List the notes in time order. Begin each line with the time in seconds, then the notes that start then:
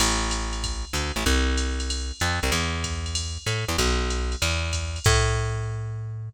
0.00 A1, crash, ride
0.31 hi-hat pedal, ride
0.53 ride
0.64 kick, ride
0.93 D2, hi-hat pedal, ride
1.16 A1, ride
1.26 C2, kick, ride
1.57 hi-hat pedal, ride
1.80 ride
1.90 ride
2.20 F2, hi-hat pedal, ride
2.43 C2, ride
2.52 E2, ride
2.84 kick, hi-hat pedal, ride
3.06 ride
3.15 ride
3.46 A2, hi-hat pedal, ride
3.68 E2, ride
3.78 B1, kick, ride
4.10 hi-hat pedal, ride
4.32 ride
4.42 E2, ride
4.73 kick, hi-hat pedal, ride
4.96 ride
5.04 A2, kick, crash